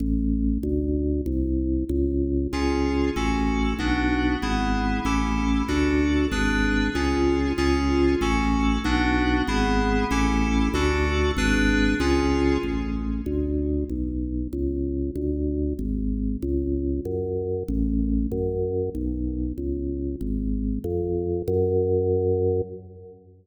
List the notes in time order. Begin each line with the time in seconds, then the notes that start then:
0.00 A1
0.63 D2
1.26 C2
1.89 C#2
2.53 C#2 C#4 F4 G#4
3.16 A1 C#4 F#4 A4
3.79 B1 B3 D4 F#4
4.42 G#1 B3 E4 G#4
5.05 A1 C#4 E4 G4 A4
5.68 D2 D4 F#4 A4
6.32 G#1 D4 G#4 B4
6.95 C#2 C#4 F4 G#4
7.58 C#2 C#4 F4 G#4
8.21 A1 C#4 F#4 A4
8.84 B1 B3 D4 F#4
9.47 G#1 B3 E4 G#4
10.11 A1 C#4 E4 G4 A4
10.74 D2 D4 F#4 A4
11.37 G#1 D4 G#4 B4
12.00 C#2 C#4 F4 G#4
12.63 A1
13.26 D2
13.89 B1
14.53 C#2
15.16 D2
15.79 G#1
16.42 C#2
17.05 F#2
17.68 A1
18.32 F#2
18.95 B1
19.58 C#2
20.21 G#1
20.84 F2
21.48 F#2